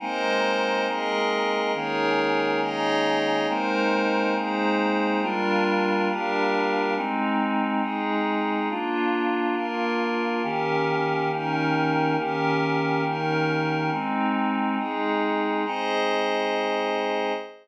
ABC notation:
X:1
M:4/4
L:1/8
Q:1/4=138
K:Ablyd
V:1 name="Choir Aahs"
[A,B,CE]8 | [E,A,B,_D]8 | [A,B,CE]8 | [G,B,DF]8 |
[A,CE]8 | [B,DF]8 | [E,B,_DG]8 | [E,B,_DG]8 |
[A,CE]8 | [A,CE]8 |]
V:2 name="Pad 5 (bowed)"
[A,Bce]4 [A,ABe]4 | [EAB_d]4 [EAde]4 | [A,EBc]4 [A,EAc]4 | [G,DFB]4 [G,DGB]4 |
[A,CE]4 [A,EA]4 | [B,DF]4 [B,FB]4 | [E,_DGB]4 [E,DEB]4 | [E,_DGB]4 [E,DEB]4 |
[A,CE]4 [A,EA]4 | [Ace]8 |]